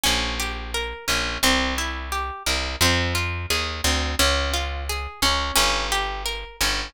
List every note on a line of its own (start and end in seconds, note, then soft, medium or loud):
0.04 0.94 A#1 loud
0.04 0.35 C#4 medium
0.40 0.71 G4 medium
0.74 1.05 A#4 medium
1.08 1.38 A#1 medium
1.08 1.39 C#4 medium
1.43 2.31 C2 loud
1.43 1.75 C4 medium
1.78 2.09 E4 medium
2.12 2.43 G4 soft
2.46 2.76 C2 medium
2.46 2.77 A#4 medium
2.81 3.46 F2 loud
2.81 3.13 C4 medium
3.15 3.46 F4 medium
3.50 3.81 D#2 medium
3.50 3.81 G#4 medium
3.84 4.15 D2 loud
3.84 4.15 C4 medium
4.19 5.07 C#2 loud
4.19 4.50 C#4 medium
4.54 4.85 F4 medium
4.89 5.20 G#4 medium
5.22 5.52 C#2 medium
5.22 5.54 C#4 medium
5.56 6.45 G1 loud
5.56 5.87 C#4 medium
5.92 6.23 G4 medium
6.26 6.57 A#4 medium
6.61 6.90 G1 loud
6.61 6.92 C#4 medium